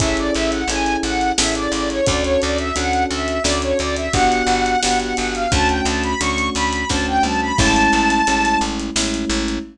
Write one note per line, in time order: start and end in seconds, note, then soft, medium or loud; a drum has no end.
0.00 0.31 A1 medium
0.00 0.62 C#4 medium
0.00 0.62 E4 loud
0.00 0.62 G#4 medium
0.00 0.62 A4 medium
0.00 0.16 E5 loud
0.00 kick loud
0.00 closed hi-hat loud
0.17 0.34 D5 loud
0.17 closed hi-hat medium
0.34 0.65 A1 medium
0.34 0.51 E5 loud
0.34 closed hi-hat medium
0.52 0.68 F#5 medium
0.52 closed hi-hat medium
0.68 0.97 A1 medium
0.68 1.31 C#4 medium
0.68 1.31 E4 medium
0.68 1.31 G#4 medium
0.68 1.31 A4 medium
0.68 0.97 G#5 loud
0.68 closed hi-hat loud
0.86 closed hi-hat medium
1.03 1.32 A1 medium
1.03 1.32 F#5 loud
1.03 closed hi-hat medium
1.21 closed hi-hat medium
1.38 1.68 A1 medium
1.38 2.00 C#4 medium
1.38 2.00 E4 medium
1.38 2.00 G#4 medium
1.38 2.00 A4 medium
1.38 1.54 E5 loud
1.38 snare loud
1.55 1.72 D5 loud
1.55 closed hi-hat medium
1.72 2.01 A1 medium
1.72 1.89 D5 loud
1.72 closed hi-hat medium
1.90 2.06 C#5 loud
1.90 closed hi-hat medium
2.06 2.37 D2 loud
2.06 2.69 C#4 medium
2.06 2.69 D4 medium
2.06 2.69 F#4 medium
2.06 2.69 A4 loud
2.06 2.23 D5 loud
2.06 kick loud
2.06 closed hi-hat loud
2.24 2.41 C#5 loud
2.24 closed hi-hat medium
2.41 2.72 D2 medium
2.41 2.58 D5 loud
2.41 closed hi-hat medium
2.58 2.75 E5 loud
2.58 closed hi-hat medium
2.76 3.06 D2 medium
2.76 3.38 C#4 medium
2.76 3.38 D4 medium
2.76 3.38 F#4 medium
2.76 3.38 A4 medium
2.76 3.04 F#5 loud
2.76 closed hi-hat loud
2.93 closed hi-hat medium
3.10 3.40 D2 medium
3.10 3.43 E5 loud
3.10 closed hi-hat medium
3.28 closed hi-hat medium
3.44 3.74 D2 medium
3.44 4.07 C#4 medium
3.44 4.07 D4 medium
3.44 4.07 F#4 medium
3.44 4.07 A4 medium
3.44 3.61 D5 loud
3.44 snare loud
3.62 3.78 C#5 medium
3.62 closed hi-hat medium
3.79 4.09 D2 medium
3.79 3.96 D5 loud
3.79 closed hi-hat medium
3.96 4.13 E5 loud
3.96 closed hi-hat medium
4.13 4.43 G1 medium
4.13 4.76 B3 medium
4.13 4.76 D4 loud
4.13 4.76 F#4 loud
4.13 4.76 G4 medium
4.13 4.81 F#5 loud
4.13 kick loud
4.13 closed hi-hat loud
4.32 closed hi-hat medium
4.47 4.76 G1 medium
4.47 closed hi-hat medium
4.66 closed hi-hat medium
4.83 5.14 G1 medium
4.83 5.45 B3 medium
4.83 5.45 D4 medium
4.83 5.45 F#4 medium
4.83 5.45 G4 medium
4.83 4.99 F#5 loud
4.83 snare loud
5.00 5.16 F#5 loud
5.00 closed hi-hat medium
5.17 5.47 G1 medium
5.17 5.34 F#5 loud
5.17 closed hi-hat loud
5.34 5.51 F5 loud
5.34 closed hi-hat medium
5.52 5.81 D2 loud
5.52 6.14 A3 medium
5.52 6.14 C#4 medium
5.52 6.14 D4 medium
5.52 6.14 F#4 loud
5.52 5.68 A5 loud
5.52 kick loud
5.52 closed hi-hat loud
5.69 5.85 G5 loud
5.69 closed hi-hat medium
5.85 6.15 D2 medium
5.85 6.03 A5 medium
5.85 closed hi-hat loud
6.03 6.20 B5 loud
6.03 closed hi-hat medium
6.21 6.50 D2 medium
6.21 6.83 A3 medium
6.21 6.83 C#4 medium
6.21 6.83 D4 medium
6.21 6.83 F#4 medium
6.21 6.50 C#6 loud
6.21 closed hi-hat loud
6.38 closed hi-hat medium
6.55 6.85 D2 medium
6.55 6.89 B5 loud
6.55 closed hi-hat medium
6.73 closed hi-hat medium
6.90 7.19 D2 medium
6.90 7.52 A3 medium
6.90 7.52 C#4 medium
6.90 7.52 D4 medium
6.90 7.52 F#4 medium
6.90 7.06 A5 loud
6.90 kick loud
6.90 snare loud
7.07 7.23 G5 loud
7.23 7.52 D2 medium
7.23 7.41 A5 loud
7.23 mid tom loud
7.41 7.58 B5 loud
7.58 7.88 A1 loud
7.58 8.21 G#3 medium
7.58 8.21 A3 loud
7.58 8.21 C#4 loud
7.58 8.21 E4 medium
7.58 8.59 A5 loud
7.58 kick loud
7.58 crash loud
7.76 closed hi-hat medium
7.93 8.22 A1 medium
7.93 closed hi-hat medium
8.10 closed hi-hat medium
8.27 8.57 A1 medium
8.27 8.90 G#3 medium
8.27 8.90 A3 medium
8.27 8.90 C#4 medium
8.27 8.90 E4 medium
8.27 closed hi-hat loud
8.45 closed hi-hat medium
8.61 8.90 A1 medium
8.61 closed hi-hat medium
8.79 closed hi-hat medium
8.96 9.25 A1 medium
8.96 9.58 G#3 medium
8.96 9.58 A3 medium
8.96 9.58 C#4 medium
8.96 9.58 E4 medium
8.96 snare loud
9.14 closed hi-hat medium
9.29 9.59 A1 medium
9.29 closed hi-hat medium
9.48 closed hi-hat medium